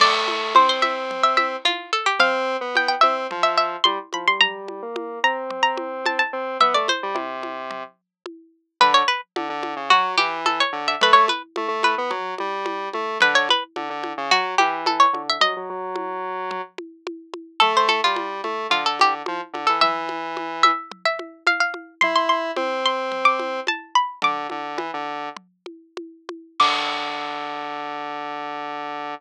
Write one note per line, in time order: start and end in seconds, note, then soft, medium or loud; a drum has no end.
0.00 0.53 A3 medium
0.00 0.51 D5 loud
0.00 crash loud
0.00 low conga loud
0.28 high conga medium
0.55 1.56 C4 medium
0.55 0.69 C5 medium
0.55 high conga loud
0.69 0.82 C5 medium
0.82 1.22 E5 medium
0.82 high conga medium
1.11 low conga medium
1.23 1.37 E5 medium
1.37 1.59 E5 medium
1.37 high conga medium
1.65 1.91 F4 medium
1.65 high conga medium
1.93 2.06 A4 medium
2.06 2.19 G4 medium
2.19 2.57 C4 loud
2.19 2.69 F5 loud
2.19 low conga loud
2.61 2.95 B3 medium
2.75 2.88 G5 medium
2.75 high conga medium
2.88 3.01 G5 medium
3.01 3.27 C4 medium
3.01 3.40 E5 medium
3.01 high conga medium
3.31 3.76 F3 medium
3.31 low conga medium
3.43 3.56 E5 medium
3.58 3.83 E5 medium
3.84 3.99 G3 medium
3.84 4.09 C6 medium
3.84 high conga loud
4.13 4.26 F3 medium
4.13 4.27 B5 medium
4.13 high conga medium
4.27 4.40 G3 medium
4.27 4.41 C6 medium
4.41 4.81 G3 medium
4.41 5.19 A#5 loud
4.41 low conga loud
4.68 high conga medium
4.82 5.19 A#3 medium
4.96 high conga loud
5.24 6.22 C4 medium
5.24 5.62 A#5 medium
5.50 low conga medium
5.63 5.98 A#5 medium
5.77 high conga medium
6.06 6.19 A5 medium
6.06 high conga medium
6.19 6.54 A5 medium
6.33 6.57 C4 medium
6.60 6.74 B3 medium
6.60 6.74 E5 medium
6.60 low conga loud
6.74 6.88 A3 medium
6.74 6.88 D5 medium
6.88 8.23 C5 medium
6.88 high conga medium
7.03 7.16 G3 medium
7.14 7.83 C3 medium
7.14 high conga loud
7.43 high conga medium
7.71 low conga medium
8.26 high conga medium
8.81 9.03 D3 loud
8.81 8.94 B4 medium
8.81 low conga loud
8.94 9.07 C#5 loud
9.08 9.21 B4 medium
9.36 9.49 D3 medium
9.36 high conga loud
9.49 9.74 D3 medium
9.63 high conga medium
9.76 9.89 C#3 medium
9.90 10.16 F#3 medium
9.90 10.13 F#4 loud
9.90 low conga loud
10.17 10.63 E3 medium
10.17 10.41 G4 medium
10.17 high conga medium
10.46 10.59 A4 medium
10.46 high conga medium
10.60 10.86 C#5 loud
10.73 10.95 D3 medium
10.88 11.01 E5 medium
11.01 11.28 A3 loud
11.01 11.16 B4 loud
11.01 low conga loud
11.13 11.26 C#5 medium
11.28 11.42 B4 medium
11.28 high conga medium
11.56 11.68 A3 medium
11.56 high conga loud
11.68 11.95 A3 medium
11.83 12.37 B4 medium
11.83 high conga medium
11.98 12.11 B3 medium
12.10 12.35 F#3 medium
12.10 low conga loud
12.38 12.89 G3 medium
12.38 high conga medium
12.66 high conga loud
12.93 13.18 A3 medium
12.93 high conga medium
13.21 13.48 D3 loud
13.21 13.35 B4 loud
13.21 low conga loud
13.35 13.48 C#5 loud
13.49 13.64 B4 medium
13.49 high conga medium
13.76 13.89 D3 medium
13.76 high conga medium
13.90 14.13 D3 medium
14.04 high conga medium
14.18 14.31 C#3 loud
14.31 14.55 F#3 medium
14.31 14.55 F#4 loud
14.31 low conga medium
14.58 15.06 E3 medium
14.58 14.84 G4 medium
14.58 high conga medium
14.86 15.00 A4 medium
14.86 high conga loud
15.00 15.22 C#5 loud
15.13 15.38 D3 medium
15.13 high conga medium
15.29 15.43 E5 loud
15.40 15.54 F#3 loud
15.40 16.38 D#5 loud
15.40 low conga loud
15.57 15.69 F#3 medium
15.70 16.61 F#3 loud
15.96 high conga medium
16.51 low conga loud
16.78 high conga medium
17.07 high conga loud
17.34 high conga medium
17.60 18.01 A3 loud
17.60 17.73 A4 loud
17.60 low conga loud
17.77 17.90 C5 medium
17.88 18.02 A4 medium
17.88 high conga medium
18.04 18.41 G3 medium
18.04 18.63 F4 medium
18.16 high conga loud
18.44 18.67 A3 medium
18.44 high conga medium
18.70 19.22 D3 medium
18.70 18.84 F4 medium
18.70 low conga medium
18.86 18.99 A4 medium
18.99 19.14 G4 medium
18.99 high conga medium
19.26 19.41 F3 medium
19.26 high conga loud
19.53 19.67 D3 medium
19.53 high conga medium
19.67 19.82 E3 medium
19.67 19.80 A4 medium
19.81 20.71 E3 loud
19.81 20.51 E5 medium
19.81 low conga loud
20.09 high conga medium
20.37 high conga medium
20.63 21.03 E5 medium
20.63 high conga medium
20.92 low conga loud
21.05 21.43 E5 medium
21.19 high conga medium
21.47 21.60 F5 medium
21.47 high conga medium
21.60 21.94 F5 medium
21.74 high conga medium
22.01 22.51 E4 medium
22.01 22.14 C6 medium
22.01 low conga loud
22.16 22.29 C6 medium
22.29 22.76 C6 medium
22.56 23.60 C4 loud
22.56 high conga loud
22.86 23.19 C6 medium
23.12 low conga medium
23.25 23.64 D6 medium
23.39 high conga medium
23.67 23.95 A5 medium
23.67 high conga medium
23.95 24.20 B5 medium
24.22 24.47 D3 loud
24.22 25.73 D6 medium
24.22 low conga loud
24.50 24.77 D3 medium
24.50 high conga medium
24.77 24.91 E3 medium
24.77 high conga loud
24.94 25.29 D3 medium
25.37 low conga medium
25.66 high conga medium
25.97 high conga medium
26.29 high conga medium
26.60 29.14 D3 loud
26.60 29.14 D6 loud
26.60 kick loud
26.60 crash loud